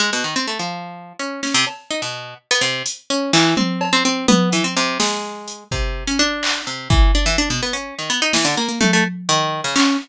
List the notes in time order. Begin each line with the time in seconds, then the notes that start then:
0.00 G#3
0.13 B2
0.24 D#3
0.36 C4
0.47 A3
0.59 F3
1.19 C#4
1.43 C#4, snare
1.54 C3
1.67 cowbell
1.91 D#4
2.02 B2
2.51 B3
2.61 C3
2.86 closed hi-hat
3.10 C#4
3.33 E3, clap
3.57 C4, high tom
3.81 cowbell
3.93 C4
4.05 C4
4.28 B3, high tom
4.52 E3, closed hi-hat
4.64 C4
4.77 C3
5.00 G#3, snare
5.48 closed hi-hat
5.71 C3, kick
6.07 C#4
6.19 D4
6.43 clap
6.67 C3
6.90 E3, kick
7.15 D4
7.26 E3
7.38 D4
7.50 B2
7.63 B3
7.73 C#4
7.99 D#3
8.10 B3
8.22 D#4
8.33 E3, snare
8.45 D3
8.57 A#3
8.68 A#3
8.81 A3, high tom
8.93 A3
9.29 D#3
9.64 C#3
9.76 C#4, clap